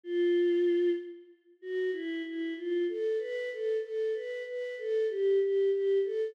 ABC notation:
X:1
M:5/8
L:1/8
Q:1/4=95
K:Fmix
V:1 name="Choir Aahs"
F3 z2 | [K:Gmix] ^F E E =F A | B A A B B | A G G G A |]